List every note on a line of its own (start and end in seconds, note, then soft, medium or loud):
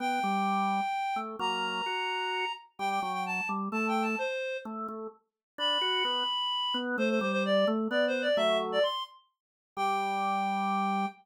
0.00 0.20 B3 loud
0.00 1.18 G5 loud
0.23 0.81 G3 loud
1.16 1.36 A3 medium
1.39 1.82 F#3 medium
1.39 1.82 A#3 loud
1.39 2.52 A#5 loud
1.86 2.45 F#4 medium
2.79 3.00 G3 medium
2.79 2.89 G5 loud
2.90 3.01 G5 medium
3.01 3.41 F#3 loud
3.01 3.12 G5 medium
3.13 3.24 G5 medium
3.26 3.48 A5 medium
3.49 3.69 G3 medium
3.72 4.15 A3 loud
3.72 3.87 A5 medium
3.88 4.03 G5 medium
4.02 4.17 A5 medium
4.18 4.57 C5 medium
4.65 4.87 A3 loud
4.88 5.07 A3 loud
5.58 5.78 D4 loud
5.58 6.77 B5 medium
5.81 6.03 F#4 loud
6.05 6.24 B3 loud
6.74 6.96 B3 loud
6.98 7.19 A3 loud
6.98 7.09 C5 loud
7.10 7.20 C5 medium
7.21 7.65 G3 loud
7.21 7.32 C5 medium
7.32 7.43 C5 loud
7.45 7.66 D5 medium
7.67 7.88 A3 loud
7.91 8.28 B3 loud
7.91 8.05 D5 medium
8.07 8.22 C5 medium
8.22 8.37 D5 medium
8.37 8.79 F#3 loud
8.37 8.79 A3 loud
8.37 8.58 E5 loud
8.72 8.83 D5 medium
8.83 9.03 C6 medium
9.77 11.06 G3 loud
9.77 11.06 G5 loud